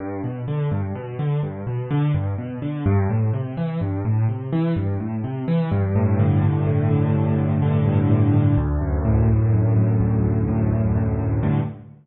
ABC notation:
X:1
M:3/4
L:1/8
Q:1/4=126
K:G
V:1 name="Acoustic Grand Piano" clef=bass
G,, B,, D, G,, B,, D, | G,, B,, D, G,, B,, D, | G,, A,, C, E, G,, A,, | C, E, G,, A,, C, E, |
G,, A,, D, G,, A,, D, | G,, A,, D, G,, A,, D, | D,, F,, A,, D,, F,, A,, | D,, F,, A,, D,, F,, A,, |
[G,,A,,D,]2 z4 |]